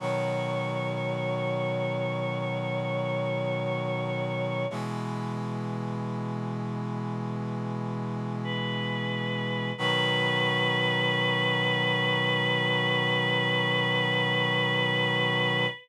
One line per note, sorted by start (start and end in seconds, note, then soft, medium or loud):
0.00 4.65 B2 medium
0.00 4.65 D#3 medium
0.00 4.65 F#3 medium
0.00 4.68 C#5 medium
4.70 9.72 B2 medium
4.70 9.72 E3 medium
4.70 9.72 G#3 medium
8.43 9.70 B4 medium
9.78 15.66 B2 medium
9.78 15.66 D#3 loud
9.78 15.66 F#3 loud
9.78 15.66 B4 loud